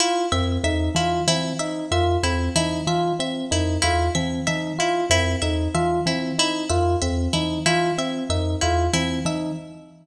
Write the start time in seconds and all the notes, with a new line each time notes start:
0.00 E4 F4
0.32 F2 C4 E5
0.64 E2 D#4 E5
0.95 E3 E4 F4
1.28 E3 C4 E4
1.59 D#4 E5
1.91 F2 F4 E5
2.23 E2 C4 E4
2.56 E3 D#4 E4
2.87 E3 F4 E5
3.19 C4 E5
3.51 F2 D#4 E4
3.82 E2 E4 F4
4.15 E3 C4 E5
4.47 E3 D#4 E5
4.79 E4 F4
5.10 F2 C4 E4
5.42 E2 D#4 E5
5.74 E3 F4 E5
6.06 E3 C4 E4
6.38 D#4 E4
6.70 F2 F4 E5
7.02 E2 C4 E5
7.33 E3 D#4 E4
7.66 E3 E4 F4
7.98 C4 E5
8.30 F2 D#4 E5
8.61 E2 E4 F4
8.93 E3 C4 E4
9.25 E3 D#4 E5